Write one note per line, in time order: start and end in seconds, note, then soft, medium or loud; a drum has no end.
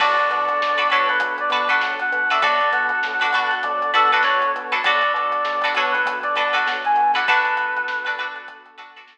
0.00 0.17 B1 medium
0.00 2.38 B3 medium
0.00 2.38 D4 medium
0.00 0.50 D4 loud
0.00 2.38 F#4 medium
0.00 0.50 F#4 medium
0.00 2.38 A4 medium
0.00 0.50 A4 medium
0.00 0.50 B4 loud
0.00 0.29 D5 loud
0.00 kick loud
0.00 crash loud
0.19 closed hi-hat medium
0.30 0.49 B2 medium
0.30 0.88 D5 medium
0.30 closed hi-hat medium
0.48 closed hi-hat medium
0.61 0.80 B1 medium
0.61 snare loud
0.77 0.88 D4 medium
0.77 0.88 F#4 medium
0.77 0.88 A4 medium
0.77 0.88 B4 medium
0.77 snare soft
0.77 closed hi-hat medium
0.90 1.11 B2 medium
0.90 1.42 D4 medium
0.90 1.42 F#4 medium
0.90 1.42 A4 medium
0.90 1.42 B4 medium
0.90 1.08 C#5 medium
0.90 closed hi-hat medium
1.09 1.36 B4 medium
1.09 closed hi-hat medium
1.20 1.40 B1 medium
1.20 kick medium
1.20 closed hi-hat loud
1.38 1.51 D5 medium
1.38 closed hi-hat medium
1.50 1.69 B2 medium
1.50 1.66 D4 medium
1.50 1.66 F#4 medium
1.50 1.66 A4 medium
1.50 1.66 B4 medium
1.50 1.68 D5 medium
1.50 closed hi-hat medium
1.69 2.16 D4 medium
1.69 2.16 F#4 medium
1.69 2.16 A4 medium
1.69 2.16 B4 medium
1.69 1.81 F#5 medium
1.69 closed hi-hat medium
1.81 2.00 B1 medium
1.81 snare loud
1.99 2.30 F#5 loud
1.99 closed hi-hat medium
2.12 2.31 B2 medium
2.12 closed hi-hat medium
2.30 2.41 D4 medium
2.30 2.41 F#4 medium
2.30 2.41 A4 medium
2.30 2.41 B4 medium
2.30 2.43 E5 medium
2.30 closed hi-hat medium
2.42 2.61 B1 medium
2.42 4.81 B3 medium
2.42 4.81 D4 medium
2.42 2.93 D4 medium
2.42 4.81 F#4 medium
2.42 2.93 F#4 medium
2.42 4.81 A4 medium
2.42 2.93 A4 loud
2.42 2.93 B4 loud
2.42 2.69 D5 loud
2.42 kick loud
2.42 closed hi-hat medium
2.61 closed hi-hat medium
2.73 2.91 B2 medium
2.73 3.55 F#5 medium
2.73 closed hi-hat medium
2.89 closed hi-hat medium
3.03 3.22 B1 medium
3.03 snare loud
3.20 3.31 D4 medium
3.20 3.31 F#4 medium
3.20 3.31 A4 medium
3.20 3.31 B4 medium
3.20 closed hi-hat medium
3.33 3.52 B2 medium
3.33 3.84 D4 medium
3.33 3.84 F#4 medium
3.33 3.84 A4 medium
3.33 3.84 B4 medium
3.33 closed hi-hat medium
3.51 closed hi-hat medium
3.63 3.82 B1 medium
3.63 3.91 D5 medium
3.63 kick medium
3.63 closed hi-hat medium
3.82 closed hi-hat medium
3.93 4.12 B2 medium
3.93 4.08 D4 medium
3.93 4.08 F#4 medium
3.93 4.08 A4 medium
3.93 4.11 A4 loud
3.93 4.08 B4 medium
3.93 closed hi-hat medium
4.12 4.59 D4 medium
4.12 4.59 F#4 medium
4.12 4.59 A4 medium
4.12 4.24 B4 medium
4.12 4.59 B4 medium
4.12 closed hi-hat medium
4.23 4.44 B1 medium
4.23 4.52 C#5 loud
4.23 snare loud
4.40 snare soft
4.40 closed hi-hat medium
4.56 4.74 B2 medium
4.56 closed hi-hat medium
4.72 4.82 D4 medium
4.72 4.82 F#4 medium
4.72 4.82 A4 medium
4.72 4.82 B4 medium
4.72 closed hi-hat medium
4.84 5.03 B1 medium
4.84 7.23 B3 medium
4.84 7.23 D4 medium
4.84 5.36 D4 medium
4.84 7.23 F#4 medium
4.84 5.36 F#4 loud
4.84 7.23 A4 medium
4.84 5.36 A4 medium
4.84 5.36 B4 medium
4.84 5.12 D5 medium
4.84 kick loud
4.84 closed hi-hat loud
5.02 closed hi-hat medium
5.14 5.32 B2 medium
5.14 5.69 D5 medium
5.14 closed hi-hat medium
5.32 closed hi-hat medium
5.45 5.63 B1 medium
5.45 snare loud
5.61 5.74 D4 medium
5.61 5.74 F#4 medium
5.61 5.74 A4 medium
5.61 5.74 B4 medium
5.61 snare soft
5.61 closed hi-hat medium
5.75 5.95 B2 medium
5.75 6.27 D4 medium
5.75 6.27 F#4 medium
5.75 6.27 A4 medium
5.75 6.27 B4 medium
5.75 5.93 C#5 medium
5.75 closed hi-hat medium
5.92 6.19 B4 medium
5.92 closed hi-hat medium
6.05 6.24 B1 medium
6.05 kick medium
6.05 closed hi-hat loud
6.23 6.35 D5 medium
6.23 closed hi-hat medium
6.35 6.55 B2 medium
6.35 6.51 D4 medium
6.35 6.51 F#4 medium
6.35 6.51 A4 medium
6.35 6.51 B4 medium
6.35 6.54 D5 medium
6.35 closed hi-hat medium
6.53 7.00 D4 medium
6.53 7.00 F#4 medium
6.53 7.00 A4 medium
6.53 7.00 B4 medium
6.53 6.67 F#5 medium
6.53 closed hi-hat medium
6.66 6.84 B1 medium
6.66 snare loud
6.85 7.12 G#5 medium
6.85 closed hi-hat medium
6.96 7.16 B2 medium
6.96 closed hi-hat medium
7.14 7.25 D4 medium
7.14 7.25 F#4 medium
7.14 7.25 A4 medium
7.14 7.25 B4 medium
7.14 7.28 F#5 medium
7.14 closed hi-hat medium
7.27 9.18 B3 medium
7.27 9.18 D4 medium
7.27 7.79 D4 loud
7.27 9.18 F#4 medium
7.27 7.79 F#4 loud
7.27 9.18 A4 medium
7.27 7.79 A4 medium
7.27 8.27 B4 loud
7.27 7.79 B4 medium
7.27 kick loud
7.27 closed hi-hat medium
7.45 closed hi-hat medium
7.57 snare soft
7.57 closed hi-hat medium
7.77 closed hi-hat medium
7.88 snare loud
8.05 8.16 D4 medium
8.05 8.16 F#4 medium
8.05 8.16 A4 medium
8.05 8.16 B4 medium
8.05 closed hi-hat medium
8.18 8.69 D4 medium
8.18 8.69 F#4 medium
8.18 8.69 A4 medium
8.18 8.69 B4 medium
8.18 closed hi-hat medium
8.35 closed hi-hat medium
8.48 kick medium
8.48 closed hi-hat medium
8.66 closed hi-hat medium
8.78 8.92 D4 medium
8.78 8.92 F#4 medium
8.78 8.92 A4 medium
8.78 8.92 B4 medium
8.78 closed hi-hat medium
8.96 9.18 D4 medium
8.96 9.18 F#4 medium
8.96 9.18 A4 medium
8.96 9.18 B4 medium
8.96 snare soft
8.96 closed hi-hat medium
9.07 snare loud